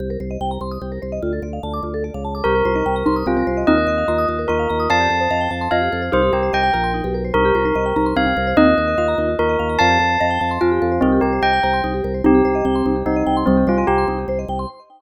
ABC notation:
X:1
M:6/8
L:1/16
Q:3/8=98
K:Cdor
V:1 name="Tubular Bells"
z12 | z12 | B8 F4 | e8 B4 |
a8 f4 | c2 G2 g4 z4 | B8 f4 | e8 B4 |
a8 F4 | C2 G2 g4 z4 | G8 E4 | C2 F F G2 z6 |]
V:2 name="Xylophone"
z12 | z12 | z2 F E z2 E2 C C z2 | [CE]4 F4 F4 |
[df]4 e4 e4 | [GB]6 B4 z2 | z2 F E z2 E2 C C z2 | [CE]4 F4 F4 |
[df]4 e4 f4 | [GB]6 c4 z2 | [CE]4 C4 C4 | G,2 G,2 z8 |]
V:3 name="Vibraphone"
G B c e g b c' e' G B c e | F A d f a d' F A d f a d' | G B c e g b c' e' G B c e | F B e f b e' F B e f b e' |
F G A c f g a c' F G A c | E G B c e g b c' E G B c | E G B c e g b c' E G B c | E F B e f b E F B e f b |
F G A c f g a c' F G A c | E G B c e g b c' E G B c | E G c e g c' E G c e g c' | E G c e g c' E G c e g c' |]
V:4 name="Drawbar Organ" clef=bass
C,,2 C,,2 C,,2 C,,2 C,,2 C,,2 | D,,2 D,,2 D,,2 D,,3 _D,,3 | C,,2 C,,2 C,,2 C,,2 C,,2 C,,2 | E,,2 E,,2 E,,2 E,,2 E,,2 E,,2 |
F,,2 F,,2 F,,2 F,,2 F,,2 F,,2 | C,,2 C,,2 C,,2 B,,,3 =B,,,3 | C,,2 C,,2 C,,2 C,,2 C,,2 C,,2 | E,,2 E,,2 E,,2 E,,2 E,,2 E,,2 |
F,,2 F,,2 F,,2 F,,2 F,,2 F,,2 | C,,2 C,,2 C,,2 C,,2 C,,2 C,,2 | C,,2 C,,2 C,,2 C,,2 C,,2 C,,2 | C,,2 C,,2 C,,2 C,,2 C,,2 C,,2 |]